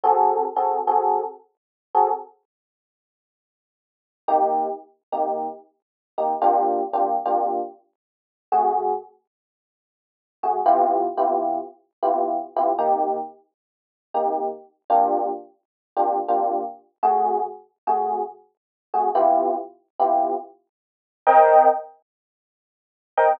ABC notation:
X:1
M:4/4
L:1/8
Q:"Swing" 1/4=113
K:Cm
V:1 name="Electric Piano 1"
[C_GA=A]2 [CG_A=A] [CG_A=A]4 [CG_A=A] | z8 | [C,B,EG]3 [C,B,EG]4 [C,B,EG] | [C,B,DFG]2 [C,B,DFG] [C,B,DFG]5 |
[C,=A,_G_A]7 [C,=A,G_A] | [C,=B,=EFG]2 [C,B,EFG]3 [C,B,EFG]2 [C,B,EFG] | [C,B,EG]5 [C,B,EG]3 | [C,B,DFG]4 [C,B,DFG] [C,B,DFG]3 |
[C,=A,_G_A]3 [C,=A,G_A]4 [C,=A,G_A] | [C,=B,=EFG]3 [C,B,EFG]5 | [CBeg]7 [CBeg] |]